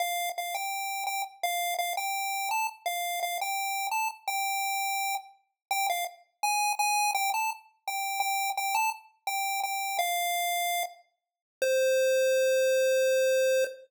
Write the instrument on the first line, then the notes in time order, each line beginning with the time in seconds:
lead 1 (square)
0.00 F5
0.38 F5
0.55 G5
1.07 G5
1.43 F5
1.79 F5
1.97 G5
2.51 A5
2.86 F5
3.23 F5
3.41 G5
3.91 A5
4.28 G5
5.71 G5
5.90 F5
6.43 G#5
6.79 G#5
7.15 G5
7.34 A5
7.88 G5
8.20 G5
8.57 G5
8.75 A5
9.27 G5
9.63 G5
9.99 F5
11.62 C5